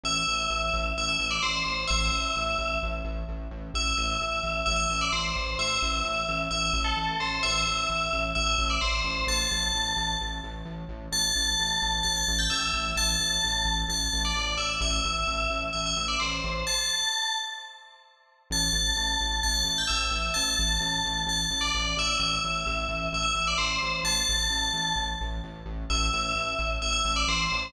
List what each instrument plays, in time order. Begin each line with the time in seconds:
0.03 synth bass 1 A1, tubular bells E5
0.27 synth bass 1 A1
0.50 synth bass 1 A1
0.73 synth bass 1 A1
0.97 synth bass 1 A1, tubular bells E5
1.09 tubular bells E5
1.19 synth bass 1 A1
1.31 tubular bells D5
1.42 synth bass 1 A1, tubular bells C5
1.65 synth bass 1 A1
1.87 synth bass 1 A1, tubular bells E5
2.11 synth bass 1 A1
2.36 synth bass 1 A1
2.58 synth bass 1 A1
2.83 synth bass 1 A1
3.04 synth bass 1 A1
3.28 synth bass 1 A1
3.51 synth bass 1 A1
3.74 synth bass 1 A1, tubular bells E5
3.97 synth bass 1 A1
4.20 synth bass 1 A1
4.43 synth bass 1 A1
4.66 synth bass 1 A1, tubular bells E5
4.76 tubular bells E5
4.90 synth bass 1 A1
5.01 tubular bells D5
5.12 synth bass 1 A1, tubular bells C5
5.36 synth bass 1 A1
5.58 synth bass 1 A1, tubular bells E5
5.82 synth bass 1 A1
6.04 synth bass 1 A1
6.28 synth bass 1 A1
6.51 synth bass 1 A1, tubular bells E5
6.73 synth bass 1 A1
6.84 tubular bells A4
6.97 synth bass 1 A1
7.20 synth bass 1 A1, tubular bells C5
7.43 synth bass 1 A1, tubular bells E5
7.67 synth bass 1 A1
7.89 synth bass 1 A1
8.13 synth bass 1 A1
8.35 synth bass 1 A1, tubular bells E5
8.47 tubular bells E5
8.58 synth bass 1 A1
8.70 tubular bells D5
8.81 synth bass 1 A1, tubular bells C5
9.04 synth bass 1 A1
9.27 synth bass 1 A1, tubular bells A5
9.51 synth bass 1 A1
9.74 synth bass 1 A1
9.97 synth bass 1 A1
10.21 synth bass 1 A1
10.43 synth bass 1 A1
10.65 synth bass 1 A1
10.89 synth bass 1 A1
11.12 synth bass 1 A1, tubular bells A5
11.35 synth bass 1 A1
11.59 synth bass 1 A1
11.82 synth bass 1 A1
12.03 synth bass 1 A1, tubular bells A5
12.17 tubular bells A5
12.28 synth bass 1 A1
12.39 tubular bells G5
12.50 synth bass 1 A1, tubular bells E5
12.73 synth bass 1 A1
12.96 synth bass 1 A1, tubular bells A5
13.19 synth bass 1 A1
13.44 synth bass 1 A1
13.65 synth bass 1 A1
13.89 synth bass 1 A1, tubular bells A5
14.13 synth bass 1 A1
14.25 tubular bells D5
14.35 synth bass 1 A1
14.57 synth bass 1 A1, tubular bells E5
14.81 synth bass 1 A1, tubular bells E5
15.04 synth bass 1 A1
15.27 synth bass 1 A1
15.50 synth bass 1 A1
15.73 synth bass 1 A1, tubular bells E5
15.86 tubular bells E5
15.96 synth bass 1 A1
16.08 tubular bells D5
16.20 synth bass 1 A1, tubular bells C5
16.44 synth bass 1 A1
16.67 tubular bells A5
18.50 synth bass 1 A1, tubular bells A5
18.73 synth bass 1 A1
18.96 synth bass 1 A1
19.21 synth bass 1 A1
19.43 synth bass 1 A1, tubular bells A5
19.54 tubular bells A5
19.65 synth bass 1 A1
19.78 tubular bells G5
19.87 synth bass 1 A1, tubular bells E5
20.11 synth bass 1 A1
20.34 synth bass 1 A1, tubular bells A5
20.59 synth bass 1 A1
20.80 synth bass 1 A1
21.05 synth bass 1 A1
21.26 synth bass 1 A1, tubular bells A5
21.50 synth bass 1 A1
21.61 tubular bells D5
21.74 synth bass 1 A1
21.97 synth bass 1 A1, tubular bells E5
22.19 synth bass 1 A1, tubular bells E5
22.44 synth bass 1 A1
22.66 synth bass 1 A1
22.89 synth bass 1 A1
23.13 synth bass 1 A1, tubular bells E5
23.23 tubular bells E5
23.35 synth bass 1 A1
23.47 tubular bells D5
23.58 synth bass 1 A1, tubular bells C5
23.82 synth bass 1 A1
24.03 synth bass 1 A1, tubular bells A5
24.29 synth bass 1 A1
24.50 synth bass 1 A1
24.73 synth bass 1 A1
24.95 synth bass 1 A1
25.21 synth bass 1 A1
25.44 synth bass 1 A1
25.65 synth bass 1 A1
25.90 synth bass 1 A1, tubular bells E5
26.13 synth bass 1 A1
26.35 synth bass 1 A1
26.59 synth bass 1 A1
26.82 synth bass 1 A1, tubular bells E5
26.93 tubular bells E5
27.05 synth bass 1 A1
27.16 tubular bells D5
27.28 synth bass 1 A1, tubular bells C5
27.52 synth bass 1 A1